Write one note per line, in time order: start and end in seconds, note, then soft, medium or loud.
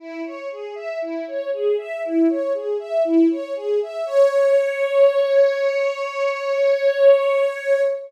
0.00 0.22 E4 medium
0.25 0.48 C#5 medium
0.51 0.75 G#4 medium
0.75 0.99 E5 medium
1.02 1.25 E4 medium
1.27 1.50 C#5 medium
1.53 1.76 G#4 medium
1.78 2.01 E5 medium
2.04 2.28 E4 medium
2.29 2.53 C#5 medium
2.54 2.78 G#4 soft
2.79 3.03 E5 medium
3.04 3.28 E4 medium
3.31 3.54 C#5 medium
3.56 3.79 G#4 medium
3.82 4.06 E5 medium
4.06 7.81 C#5 loud